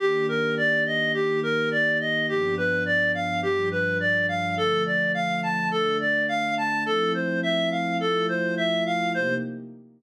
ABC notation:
X:1
M:4/4
L:1/8
Q:1/4=105
K:Cdor
V:1 name="Clarinet"
G B d e G B d e | G =B d f G B d f | A d f a A d f a | A c =e f A c e f |
c2 z6 |]
V:2 name="Pad 2 (warm)"
[E,B,DG]4 [E,B,EG]4 | [G,,F,=B,D]4 [G,,F,G,D]4 | [D,F,A,]4 [D,A,D]4 | [F,A,C=E]4 [F,A,EF]4 |
[C,B,EG]2 z6 |]